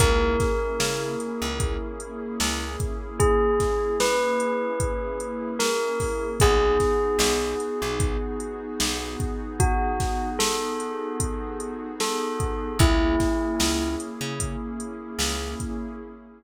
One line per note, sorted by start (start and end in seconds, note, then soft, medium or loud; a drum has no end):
0.00 0.37 C#2 medium
0.00 6.27 A#3 medium
0.00 6.27 C#4 medium
0.00 6.27 E4 medium
0.00 6.27 G#4 medium
0.00 2.99 A#4 loud
0.00 kick loud
0.00 closed hi-hat loud
0.40 kick medium
0.40 snare medium
0.40 closed hi-hat medium
0.80 1.16 C#3 medium
0.80 snare loud
1.20 closed hi-hat medium
1.42 1.77 C#2 medium
1.60 kick medium
1.60 closed hi-hat loud
2.00 closed hi-hat medium
2.40 2.77 C#2 medium
2.40 snare loud
2.80 kick medium
2.80 closed hi-hat medium
3.20 3.95 G#4 medium
3.20 kick loud
3.20 closed hi-hat loud
3.60 kick medium
3.60 snare medium
3.60 closed hi-hat medium
4.00 5.54 B4 medium
4.00 snare loud
4.40 closed hi-hat medium
4.80 kick medium
4.80 closed hi-hat loud
5.20 closed hi-hat medium
5.59 6.31 A#4 medium
5.59 snare loud
6.00 kick medium
6.00 snare soft
6.00 open hi-hat medium
6.40 6.78 B1 loud
6.40 12.68 B3 medium
6.40 12.68 D#4 medium
6.40 12.68 F#4 loud
6.40 12.68 G#4 medium
6.40 9.48 G#4 loud
6.40 kick loud
6.40 closed hi-hat loud
6.80 kick medium
6.80 snare medium
6.80 closed hi-hat medium
7.19 7.55 B1 medium
7.19 snare loud
7.60 closed hi-hat medium
7.82 8.18 B1 medium
8.00 kick loud
8.00 closed hi-hat loud
8.40 closed hi-hat medium
8.80 9.17 B1 medium
8.80 snare loud
9.20 kick medium
9.20 closed hi-hat medium
9.60 10.29 F#4 medium
9.60 kick loud
9.60 closed hi-hat loud
10.00 kick medium
10.00 snare medium
10.00 closed hi-hat medium
10.39 11.87 A4 medium
10.39 snare loud
10.80 closed hi-hat medium
11.20 kick medium
11.20 closed hi-hat loud
11.60 closed hi-hat medium
12.00 12.77 A4 medium
12.00 snare loud
12.40 kick medium
12.40 closed hi-hat medium
12.79 13.16 C#2 medium
12.79 15.94 A#3 medium
12.79 15.94 C#4 medium
12.79 15.94 E4 medium
12.79 13.95 E4 loud
12.79 15.94 G#4 medium
12.79 kick loud
12.79 closed hi-hat loud
13.20 kick medium
13.20 snare medium
13.20 closed hi-hat medium
13.60 13.96 C#2 medium
13.60 snare loud
14.00 closed hi-hat medium
14.21 14.57 C#3 medium
14.40 kick medium
14.40 closed hi-hat loud
14.80 closed hi-hat medium
15.19 15.55 C#2 medium
15.19 snare loud
15.60 kick medium
15.60 closed hi-hat medium